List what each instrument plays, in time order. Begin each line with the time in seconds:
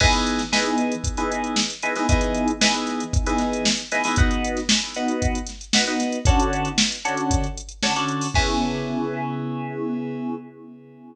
0.00 electric piano 2 E3 B3 D#4 G#4, kick, crash
0.13 snare, closed hi-hat
0.27 closed hi-hat
0.38 snare, closed hi-hat
0.52 electric piano 2 E3 B3 D#4 G#4, snare
0.66 closed hi-hat
0.78 closed hi-hat
0.92 closed hi-hat
1.04 kick, closed hi-hat
1.17 electric piano 2 E3 B3 D#4 G#4, closed hi-hat
1.32 closed hi-hat
1.44 closed hi-hat
1.56 snare
1.70 closed hi-hat
1.82 electric piano 2 E3 B3 D#4 G#4, closed hi-hat
1.96 electric piano 2 E3 B3 D#4 G#4, snare, closed hi-hat
2.09 electric piano 2 E3 B3 D#4 G#4, kick, closed hi-hat
2.21 closed hi-hat
2.34 closed hi-hat
2.48 closed hi-hat
2.61 electric piano 2 E3 B3 D#4 G#4, snare
2.74 closed hi-hat
2.87 snare, closed hi-hat
3.00 closed hi-hat
3.13 kick, closed hi-hat
3.26 electric piano 2 E3 B3 D#4 G#4, closed hi-hat
3.38 snare, closed hi-hat
3.53 closed hi-hat
3.65 snare
3.77 closed hi-hat
3.91 electric piano 2 E3 B3 D#4 G#4, snare, closed hi-hat
4.04 electric piano 2 E3 B3 D#4 G#4, snare, open hi-hat
4.16 electric piano 2 B3 D#4 F#4, kick, closed hi-hat
4.31 closed hi-hat
4.44 closed hi-hat
4.57 snare, closed hi-hat
4.69 snare
4.82 closed hi-hat
4.94 electric piano 2 B3 D#4 F#4, closed hi-hat
5.08 closed hi-hat
5.22 kick, closed hi-hat
5.35 closed hi-hat
5.47 snare, closed hi-hat
5.61 closed hi-hat
5.73 electric piano 2 B3 D#4 F#4, snare
5.87 electric piano 2 B3 D#4 F#4, closed hi-hat
6.00 snare, closed hi-hat
6.12 closed hi-hat
6.25 electric piano 2 D3 C#4 F#4 A4, kick, closed hi-hat
6.40 closed hi-hat
6.53 closed hi-hat
6.65 closed hi-hat
6.78 snare
6.92 closed hi-hat
7.04 electric piano 2 D3 C#4 F#4 A4, closed hi-hat
7.17 closed hi-hat
7.31 kick, closed hi-hat
7.44 closed hi-hat
7.57 closed hi-hat
7.69 closed hi-hat
7.82 electric piano 2 D3 C#4 F#4 A4, snare
7.94 electric piano 2 D3 C#4 F#4 A4, snare, closed hi-hat
8.08 closed hi-hat
8.21 open hi-hat
8.34 electric piano 2 C#3 B3 E4 G#4, kick, crash